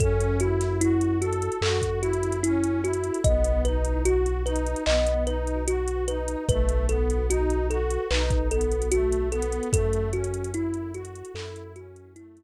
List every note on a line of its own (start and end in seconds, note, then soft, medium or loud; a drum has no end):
0.00 1.49 F#2 loud
0.00 0.37 C#4 loud
0.00 0.38 A4 loud
0.00 kick medium
0.00 closed hi-hat medium
0.20 closed hi-hat medium
0.40 0.77 E4 medium
0.40 0.78 F#4 medium
0.40 closed hi-hat medium
0.61 snare soft
0.61 closed hi-hat medium
0.81 1.18 E4 loud
0.81 1.18 F#4 medium
0.81 closed hi-hat medium
1.01 closed hi-hat medium
1.20 1.59 F#4 medium
1.20 1.57 A4 medium
1.20 closed hi-hat medium
1.33 closed hi-hat medium
1.42 closed hi-hat medium
1.52 closed hi-hat medium
1.61 3.11 F#2 medium
1.61 1.99 F#4 medium
1.61 1.99 A4 medium
1.61 clap medium
1.82 kick medium
1.82 closed hi-hat medium
2.01 2.38 E4 medium
2.01 2.40 F#4 medium
2.01 closed hi-hat medium
2.13 closed hi-hat medium
2.23 closed hi-hat medium
2.32 closed hi-hat medium
2.43 2.81 C#4 medium
2.43 2.81 E4 loud
2.43 closed hi-hat medium
2.64 closed hi-hat medium
2.82 3.19 E4 medium
2.82 3.21 F#4 medium
2.82 closed hi-hat medium
2.93 closed hi-hat medium
3.04 closed hi-hat medium
3.14 closed hi-hat medium
3.24 4.75 B1 loud
3.24 3.62 B3 medium
3.24 3.61 D#5 loud
3.24 kick medium
3.24 closed hi-hat medium
3.44 closed hi-hat medium
3.65 4.02 D#4 medium
3.65 4.02 B4 medium
3.65 closed hi-hat medium
3.85 closed hi-hat medium
4.04 4.41 F#4 medium
4.04 4.43 F#4 loud
4.04 closed hi-hat medium
4.26 closed hi-hat medium
4.45 4.81 D#4 medium
4.45 4.83 B4 medium
4.45 closed hi-hat medium
4.56 closed hi-hat medium
4.67 closed hi-hat medium
4.76 closed hi-hat medium
4.86 6.36 B1 medium
4.86 5.23 B3 medium
4.86 5.24 D#5 loud
4.86 clap medium
5.07 closed hi-hat medium
5.26 5.63 D#4 medium
5.26 5.64 B4 medium
5.26 closed hi-hat medium
5.47 closed hi-hat medium
5.67 6.04 F#4 medium
5.67 6.05 F#4 loud
5.67 closed hi-hat medium
5.88 closed hi-hat medium
6.08 6.45 D#4 medium
6.08 6.45 B4 medium
6.08 closed hi-hat medium
6.28 closed hi-hat medium
6.49 7.98 B1 loud
6.49 6.85 A3 loud
6.49 6.86 B4 loud
6.49 kick medium
6.49 closed hi-hat medium
6.69 closed hi-hat medium
6.89 7.26 B3 medium
6.89 7.26 A4 medium
6.89 closed hi-hat medium
7.10 closed hi-hat medium
7.29 7.66 D#4 medium
7.29 7.67 F#4 loud
7.29 closed hi-hat medium
7.50 closed hi-hat medium
7.70 8.06 F#4 medium
7.70 8.08 A4 medium
7.70 closed hi-hat medium
7.91 closed hi-hat medium
8.11 9.60 B1 medium
8.11 8.48 D#4 medium
8.11 8.48 B4 loud
8.11 clap medium
8.30 kick medium
8.30 closed hi-hat medium
8.51 8.88 B3 medium
8.51 8.89 A4 medium
8.51 closed hi-hat medium
8.61 closed hi-hat medium
8.72 closed hi-hat medium
8.82 closed hi-hat medium
8.91 9.28 A3 medium
8.91 9.29 F#4 loud
8.91 closed hi-hat medium
9.13 closed hi-hat medium
9.32 9.68 B3 medium
9.32 9.69 A4 medium
9.32 closed hi-hat medium
9.42 closed hi-hat medium
9.52 closed hi-hat medium
9.63 closed hi-hat soft
9.73 11.23 F#2 medium
9.73 10.09 A3 loud
9.73 10.10 A4 loud
9.73 kick medium
9.73 closed hi-hat loud
9.93 closed hi-hat medium
10.13 10.51 C#4 medium
10.13 10.51 F#4 medium
10.13 closed hi-hat medium
10.24 closed hi-hat medium
10.34 closed hi-hat medium
10.44 closed hi-hat medium
10.54 10.90 E4 medium
10.54 10.92 E4 loud
10.54 closed hi-hat medium
10.74 closed hi-hat medium
10.94 11.32 F#4 medium
10.94 11.31 F#4 medium
10.94 closed hi-hat medium
11.05 closed hi-hat medium
11.15 closed hi-hat medium
11.25 closed hi-hat medium
11.34 12.43 F#2 medium
11.34 11.72 E4 medium
11.34 11.72 A4 loud
11.34 clap medium
11.56 closed hi-hat medium
11.76 12.13 C#4 medium
11.76 12.13 F#4 medium
11.76 closed hi-hat medium
11.96 closed hi-hat medium
12.16 12.43 A3 medium
12.16 12.43 E4 loud
12.16 closed hi-hat medium
12.37 closed hi-hat medium